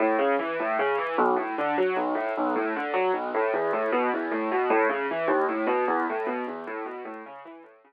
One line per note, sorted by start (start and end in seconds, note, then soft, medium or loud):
0.00 0.17 A2 medium
0.19 0.36 C#3 medium
0.39 0.57 E3 medium
0.60 0.77 A2 medium
0.79 0.97 C#3 medium
0.98 1.16 E3 medium
1.18 1.36 B1 loud
1.36 1.54 A2 medium
1.58 1.76 D3 medium
1.78 1.95 F#3 medium
1.96 2.14 B1 medium
2.15 2.33 A2 medium
2.37 2.55 B1 medium
2.56 2.73 A2 medium
2.76 2.94 D3 medium
2.94 3.11 F#3 medium
3.14 3.31 B1 medium
3.34 3.52 A2 medium
3.54 3.71 E2 medium
3.73 3.91 A2 medium
3.92 4.10 B2 medium
4.14 4.31 E2 medium
4.31 4.49 A2 medium
4.52 4.69 B2 medium
4.70 4.88 A2 loud
4.89 5.07 C#3 medium
5.11 5.29 E3 medium
5.28 5.45 D#2 loud
5.49 5.66 A2 medium
5.67 5.84 B2 medium
5.88 6.05 E2 medium
6.10 6.27 A2 medium
6.27 6.44 B2 medium
6.47 6.65 E2 medium
6.67 6.85 A2 medium
6.86 7.03 B2 medium
7.05 7.23 A2 medium
7.26 7.44 C#3 medium
7.45 7.63 E3 medium
7.63 7.81 A2 medium
7.84 7.93 C#3 medium